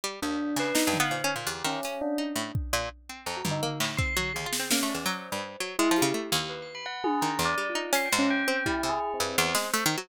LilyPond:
<<
  \new Staff \with { instrumentName = "Pizzicato Strings" } { \time 4/4 \tempo 4 = 167 g8 ees,4 des8 \tuplet 3/2 { ees'8 g,8 b8 bes,8 des'8 bes,8 } | e,8 ees8 des'8 r8 ees'8 a,8 r8 bes,8 | r8 c'8 f,8 g,8 bes8 a,8 c'8 ges8 | \tuplet 3/2 { ees,8 f'8 c'8 bes8 a8 e,8 } ges8. g,8. ges8 |
\tuplet 3/2 { aes8 f8 des8 } a8 ees,2~ ees,8 | ees8 e,8 g8 ees'8 des'8 aes,4 c'8 | g8 c8 r8 g,8 e,8 aes8 \tuplet 3/2 { a8 ees8 ges8 } | }
  \new Staff \with { instrumentName = "Tubular Bells" } { \time 4/4 r8 d'4 b'8 \tuplet 3/2 { ees'8 g''8 f''8 } c''8 r8 | g'8 des'4 d'8 r2 | r4 \tuplet 3/2 { bes''8 ges'8 ees'8 } r4 c'''4 | aes'4 des'8 d''8 c''4 r4 |
e'8 g'8 r4 \tuplet 3/2 { b'8 c'''8 b''8 } ges''8 aes'8 | \tuplet 3/2 { bes''4 d''4 f'4 c'''8 g''8 des'8 } g''4 | \tuplet 3/2 { e'4 aes'4 c'4 } c''2 | }
  \new DrumStaff \with { instrumentName = "Drums" } \drummode { \time 4/4 r4 r8 hc8 sn8 tomfh8 r4 | r8 hc8 hh4 r4 bd4 | r4 r8 tomfh8 tomfh8 hc8 bd8 tomfh8 | r8 sn8 sn8 cb8 hh4 r4 |
r8 hh8 r4 r4 r8 tommh8 | r4 r4 hh8 hc8 r4 | bd8 cb8 r4 r8 sn8 hh4 | }
>>